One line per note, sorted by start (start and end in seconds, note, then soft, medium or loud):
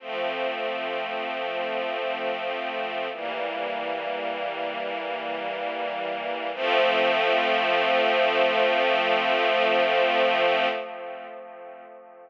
0.00 3.08 F3 medium
0.00 3.08 A3 medium
0.00 3.08 C4 medium
3.12 6.51 E3 medium
3.12 6.51 G3 medium
3.12 6.51 A#3 medium
6.54 10.67 F3 loud
6.54 10.67 A3 loud
6.54 10.67 C4 medium